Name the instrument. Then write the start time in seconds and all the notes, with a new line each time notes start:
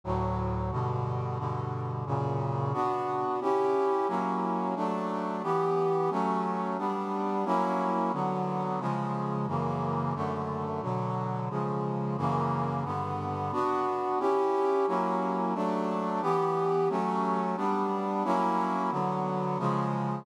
brass section
0.04 D2 A2 F#3
0.71 G2 B2 D3
1.38 G2 B2 D3
2.06 F#2 A#2 C#3
2.73 B3 D4 F#4
3.41 C#4 E4 G4
4.08 F#3 A#3 C#4 E4
4.76 F#3 A3 D4
5.43 E3 B3 G4
6.10 F#3 A3 C#4
6.78 G3 B3 D4
7.45 F#3 A#3 C#4 E4
8.13 D3 F#3 B3
8.80 C#3 F3 G#3
9.47 F#2 C#3 E3 A#3
10.15 F#2 D3 A3
10.82 B2 D3 F#3
11.50 C#3 F3 G#3
12.17 F#2 C#3 E3 A#3
12.85 G2 D3 B3
13.52 B3 D4 F#4
14.19 C#4 E4 G4
14.87 F#3 A#3 C#4 E4
15.54 F#3 A3 D4
16.22 E3 B3 G4
16.89 F#3 A3 C#4
17.56 G3 B3 D4
18.24 F#3 A#3 C#4 E4
18.91 D3 F#3 B3
19.58 C#3 F3 G#3